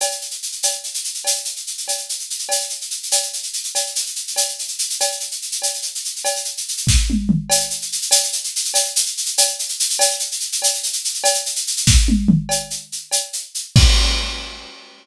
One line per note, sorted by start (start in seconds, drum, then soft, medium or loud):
0.01 cowbell medium
0.01 shaker medium
0.11 shaker medium
0.21 shaker medium
0.31 shaker medium
0.42 shaker medium
0.52 shaker medium
0.63 cowbell medium
0.63 shaker medium
0.71 shaker medium
0.84 shaker medium
0.94 shaker medium
1.04 shaker medium
1.14 shaker medium
1.24 cowbell medium
1.24 shaker loud
1.36 shaker medium
1.45 shaker medium
1.56 shaker medium
1.67 shaker medium
1.78 shaker medium
1.88 cowbell medium
1.88 shaker medium
1.97 shaker medium
2.09 shaker medium
2.19 shaker medium
2.30 shaker medium
2.39 shaker medium
2.49 cowbell medium
2.49 shaker medium
2.60 shaker medium
2.69 shaker medium
2.81 shaker medium
2.90 shaker medium
3.03 shaker medium
3.11 cowbell medium
3.11 shaker loud
3.22 shaker medium
3.33 shaker medium
3.43 shaker medium
3.53 shaker medium
3.64 shaker medium
3.75 cowbell medium
3.75 shaker medium
3.86 shaker medium
3.95 shaker medium
4.06 shaker medium
4.15 shaker medium
4.27 shaker medium
4.36 cowbell medium
4.36 shaker loud
4.48 shaker medium
4.59 shaker medium
4.68 shaker medium
4.79 shaker medium
4.90 shaker medium
5.00 cowbell medium
5.00 shaker medium
5.11 shaker medium
5.20 shaker medium
5.31 shaker medium
5.42 shaker medium
5.52 shaker medium
5.62 cowbell medium
5.62 shaker medium
5.74 shaker medium
5.82 shaker medium
5.95 shaker medium
6.05 shaker medium
6.16 shaker medium
6.25 cowbell medium
6.25 shaker medium
6.36 shaker medium
6.45 shaker medium
6.57 shaker medium
6.68 shaker medium
6.77 shaker medium
6.87 kick medium
6.87 snare medium
7.10 high tom medium
7.29 mid tom medium
7.50 cowbell medium
7.50 shaker loud
7.60 shaker medium
7.70 shaker medium
7.82 shaker medium
7.92 shaker medium
8.02 shaker medium
8.11 cowbell medium
8.11 shaker loud
8.23 shaker medium
8.32 shaker medium
8.44 shaker medium
8.56 shaker medium
8.65 shaker medium
8.74 cowbell medium
8.74 shaker loud
8.85 shaker medium
8.96 shaker loud
9.06 shaker medium
9.17 shaker medium
9.26 shaker medium
9.38 cowbell medium
9.38 shaker loud
9.48 shaker medium
9.59 shaker medium
9.69 shaker medium
9.80 shaker loud
9.90 shaker medium
9.99 cowbell loud
9.99 shaker loud
10.10 shaker medium
10.19 shaker medium
10.32 shaker medium
10.40 shaker medium
10.52 shaker medium
10.62 cowbell medium
10.62 shaker loud
10.74 shaker medium
10.83 shaker medium
10.93 shaker medium
11.04 shaker medium
11.14 shaker medium
11.24 cowbell loud
11.24 shaker loud
11.34 shaker medium
11.46 shaker medium
11.56 shaker medium
11.67 shaker medium
11.77 shaker medium
11.87 kick medium
11.87 snare medium
12.08 high tom medium
12.28 mid tom loud
12.49 cowbell medium
12.49 shaker medium
12.70 shaker medium
12.92 shaker medium
13.11 cowbell medium
13.11 shaker medium
13.33 shaker medium
13.55 shaker medium
13.76 kick loud
13.76 crash loud